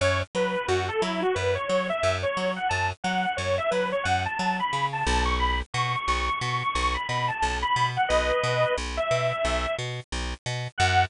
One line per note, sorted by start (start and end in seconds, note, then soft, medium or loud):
0.01 0.23 F#2 medium
0.01 0.20 C#5 medium
0.35 0.56 F#3 medium
0.35 0.67 B4 medium
0.68 0.90 F#2 medium
0.68 0.87 F#4 medium
0.88 1.01 A4 medium
1.01 1.24 F#3 medium
1.01 1.21 E4 medium
1.22 1.35 F#4 medium
1.35 1.58 F#2 medium
1.35 1.54 B4 medium
1.55 1.67 C#5 medium
1.68 1.91 F#3 medium
1.68 1.87 C#5 medium
1.89 2.16 E5 medium
2.03 2.25 F#2 medium
2.22 2.52 C#5 medium
2.37 2.59 F#3 medium
2.56 2.69 F#5 medium
2.69 2.92 F#2 medium
2.69 2.88 A5 medium
3.04 3.26 F#3 medium
3.04 3.35 F#5 medium
3.37 3.60 F#2 medium
3.37 3.56 C#5 medium
3.58 3.70 E5 medium
3.71 3.94 F#3 medium
3.71 3.90 B4 medium
3.92 4.04 C#5 medium
4.03 4.27 F#2 medium
4.03 4.23 F#5 medium
4.25 4.38 A5 medium
4.38 4.61 F#3 medium
4.38 4.58 A5 medium
4.60 4.86 B5 medium
4.73 5.04 C#3 medium
4.93 5.23 A5 medium
5.07 5.62 B1 medium
5.25 5.38 C#6 medium
5.39 5.59 B5 medium
5.74 5.96 B2 medium
5.74 6.05 C#6 medium
6.06 6.29 B1 medium
6.06 6.26 C#6 medium
6.26 6.39 C#6 medium
6.41 6.63 B2 medium
6.41 6.60 C#6 medium
6.61 6.74 C#6 medium
6.74 6.97 B1 medium
6.74 6.94 C#6 medium
6.94 7.07 B5 medium
7.08 7.31 B2 medium
7.08 7.28 B5 medium
7.28 7.57 A5 medium
7.42 7.64 B1 medium
7.62 7.88 B5 medium
7.76 7.98 B2 medium
7.96 8.09 F#5 medium
8.08 8.32 B1 medium
8.08 8.74 B4 medium
8.08 8.74 D#5 medium
8.44 8.65 B2 medium
8.78 8.99 B1 medium
8.97 9.75 E5 medium
9.11 9.33 B2 medium
9.45 9.66 B1 medium
9.79 10.00 B2 medium
10.12 10.34 B1 medium
10.46 10.68 B2 medium
10.78 11.05 F#2 medium
10.78 11.03 F#5 loud